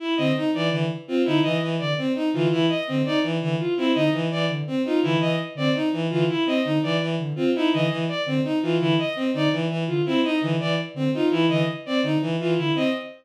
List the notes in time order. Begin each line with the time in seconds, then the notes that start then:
0.00 E4
0.17 D3 C4 D#5
0.36 D#4
0.54 E3 D5
0.71 D3 E3
1.08 C4 F4
1.25 D3 D#4 E4
1.42 E3 D#5
1.62 E3
1.79 D3 D5
1.98 C4
2.15 D#4
2.33 D3 E3 F4
2.51 E3 E4
2.69 D#5
2.87 D3 C4
3.05 D#4 D5
3.23 E3
3.41 D3 E3
3.59 F4
3.77 C4 E4
3.95 D3 D#4 D#5
4.13 E3
4.31 E3 D5
4.49 D3
4.67 C4
4.85 D#4 F4
5.03 D3 E3 E4
5.21 E3 D#5
5.55 D3 C4 D5
5.75 D#4
5.93 E3
6.10 D3 E3 F4
6.29 E4
6.46 C4 D#5
6.64 D3 D#4
6.83 E3 D5
7.01 E3
7.19 D3
7.36 C4 F4
7.55 D#4 E4
7.73 D3 E3 D#5
7.90 E3
8.08 D5
8.26 D3 C4
8.44 D#4
8.62 E3 F4
8.80 D3 E3 E4
8.99 D#5
9.16 C4
9.34 D3 D#4 D5
9.52 E3
9.70 E3
9.87 D3 F4
10.06 C4 E4
10.24 D#4 D#5
10.41 D3 E3
10.60 E3 D5
10.94 D3 C4
11.14 D#4 F4
11.31 E3 E4
11.49 D3 E3 D#5
11.86 C4 D5
12.03 D3 D#4
12.21 E3
12.39 E3 F4
12.57 D3 E4
12.75 C4 D#5